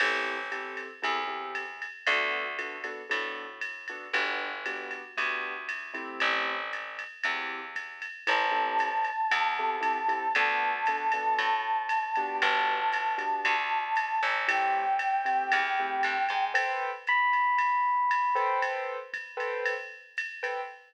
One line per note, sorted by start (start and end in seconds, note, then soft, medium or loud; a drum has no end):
0.00 0.83 A1 medium
0.00 0.37 C4 medium
0.00 0.37 E4 medium
0.00 0.37 G4 medium
0.00 0.37 A4 medium
0.00 crash loud
0.00 ride loud
0.52 0.88 C4 medium
0.52 0.88 E4 medium
0.52 0.88 G4 medium
0.52 0.88 A4 medium
0.52 hi-hat pedal medium
0.52 ride medium
0.77 ride medium
1.02 1.87 E2 medium
1.02 1.20 C4 medium
1.02 1.20 E4 medium
1.02 1.20 G4 medium
1.02 1.20 A4 medium
1.02 kick medium
1.02 ride medium
1.27 1.63 C4 medium
1.27 1.63 E4 medium
1.27 1.63 G4 medium
1.27 1.63 A4 medium
1.55 hi-hat pedal medium
1.55 ride medium
1.82 ride medium
2.07 2.90 D2 loud
2.07 2.44 B3 medium
2.07 2.44 D4 medium
2.07 2.44 F#4 medium
2.07 2.44 A4 medium
2.07 ride loud
2.59 2.77 B3 medium
2.59 2.77 D4 medium
2.59 2.77 F#4 medium
2.59 2.77 A4 medium
2.59 hi-hat pedal medium
2.59 ride medium
2.84 3.02 B3 medium
2.84 3.02 D4 medium
2.84 3.02 F#4 medium
2.84 3.02 A4 medium
2.84 ride medium
3.09 3.94 A2 medium
3.09 3.46 B3 medium
3.09 3.46 D4 medium
3.09 3.46 F#4 medium
3.09 3.46 A4 medium
3.09 ride loud
3.61 hi-hat pedal medium
3.61 ride medium
3.88 4.08 B3 medium
3.88 4.08 D4 medium
3.88 4.08 F#4 medium
3.88 4.08 A4 medium
3.88 ride medium
4.13 4.96 G1 medium
4.13 4.50 B3 medium
4.13 4.50 D4 medium
4.13 4.50 F#4 medium
4.13 4.50 G4 medium
4.13 ride loud
4.66 5.02 B3 medium
4.66 5.02 D4 medium
4.66 5.02 F#4 medium
4.66 5.02 G4 medium
4.66 hi-hat pedal medium
4.66 ride medium
4.91 ride medium
5.17 6.00 D2 medium
5.17 5.54 B3 medium
5.17 5.54 D4 medium
5.17 5.54 F#4 medium
5.17 5.54 G4 medium
5.17 kick medium
5.17 ride medium
5.69 hi-hat pedal medium
5.69 ride medium
5.94 6.56 A3 medium
5.94 6.56 C4 medium
5.94 6.56 E4 medium
5.94 6.56 G4 medium
5.94 ride medium
6.20 7.04 A1 medium
6.20 ride loud
6.73 hi-hat pedal medium
6.73 ride medium
6.99 ride medium
7.23 8.07 E2 medium
7.23 7.61 A3 medium
7.23 7.61 C4 medium
7.23 7.61 E4 medium
7.23 7.61 G4 medium
7.23 ride loud
7.76 kick medium
7.76 hi-hat pedal medium
7.76 ride medium
8.02 ride medium
8.27 9.11 A1 medium
8.27 8.45 C4 medium
8.27 8.45 E4 medium
8.27 8.45 G4 medium
8.27 8.45 A4 medium
8.27 10.32 A5 medium
8.27 kick medium
8.27 ride loud
8.51 8.88 C4 medium
8.51 8.88 E4 medium
8.51 8.88 G4 medium
8.51 8.88 A4 medium
8.79 hi-hat pedal medium
8.79 ride medium
9.05 ride medium
9.31 10.14 E2 medium
9.31 kick medium
9.31 ride loud
9.59 9.77 C4 medium
9.59 9.77 E4 medium
9.59 9.77 G4 medium
9.59 9.77 A4 medium
9.81 9.99 C4 medium
9.81 9.99 E4 medium
9.81 9.99 G4 medium
9.81 9.99 A4 medium
9.81 kick medium
9.81 hi-hat pedal medium
9.81 ride medium
10.08 10.26 C4 medium
10.08 10.26 E4 medium
10.08 10.26 G4 medium
10.08 10.26 A4 medium
10.08 ride medium
10.35 11.18 D2 medium
10.35 10.72 B3 medium
10.35 10.72 D4 medium
10.35 10.72 F#4 medium
10.35 10.72 A4 medium
10.35 12.36 A5 medium
10.35 ride loud
10.86 11.06 B3 medium
10.86 11.06 D4 medium
10.86 11.06 F#4 medium
10.86 11.06 A4 medium
10.86 hi-hat pedal medium
10.86 ride medium
11.12 11.50 B3 medium
11.12 11.50 D4 medium
11.12 11.50 F#4 medium
11.12 11.50 A4 medium
11.12 ride medium
11.38 12.21 A2 medium
11.38 ride loud
11.89 hi-hat pedal loud
11.89 ride loud
12.16 12.79 B3 medium
12.16 12.79 D4 medium
12.16 12.79 F#4 medium
12.16 12.79 G4 medium
12.16 ride medium
12.41 13.25 G1 medium
12.41 14.34 A5 medium
12.41 ride loud
12.92 hi-hat pedal medium
12.92 ride loud
13.18 13.54 B3 medium
13.18 13.54 D4 medium
13.18 13.54 F#4 medium
13.18 13.54 G4 medium
13.18 ride medium
13.45 14.19 D2 medium
13.45 kick medium
13.45 ride loud
13.96 hi-hat pedal medium
13.96 ride loud
14.23 15.31 A1 medium
14.23 ride medium
14.48 14.84 A3 medium
14.48 14.84 C4 medium
14.48 14.84 E4 medium
14.48 14.84 G4 medium
14.48 16.44 G5 medium
14.48 ride loud
14.99 hi-hat pedal medium
14.99 ride medium
15.25 15.61 A3 medium
15.25 15.61 C4 medium
15.25 15.61 E4 medium
15.25 15.61 G4 medium
15.25 ride medium
15.52 16.02 E2 medium
15.52 ride loud
15.80 16.16 A3 medium
15.80 16.16 C4 medium
15.80 16.16 E4 medium
15.80 16.16 G4 medium
16.03 16.28 G2 medium
16.03 hi-hat pedal medium
16.03 ride loud
16.29 16.53 G#2 medium
16.29 ride medium
16.54 16.90 A4 loud
16.54 16.90 B4 loud
16.54 16.90 C5 medium
16.54 16.90 G5 medium
16.54 ride loud
17.07 18.59 B5 medium
17.07 hi-hat pedal medium
17.07 ride medium
17.33 ride medium
17.58 kick medium
17.58 ride loud
18.11 hi-hat pedal medium
18.11 ride loud
18.35 18.97 A4 loud
18.35 18.97 B4 medium
18.35 18.97 C5 loud
18.35 18.97 G5 medium
18.35 ride medium
18.62 kick medium
18.62 ride loud
19.13 kick medium
19.13 hi-hat pedal medium
19.13 ride medium
19.37 19.73 A4 medium
19.37 19.73 B4 medium
19.37 19.73 C5 medium
19.37 19.73 G5 medium
19.37 ride medium
19.66 ride loud
20.17 hi-hat pedal medium
20.17 ride loud
20.43 20.61 A4 medium
20.43 20.61 B4 medium
20.43 20.61 C5 medium
20.43 20.61 G5 medium
20.43 ride medium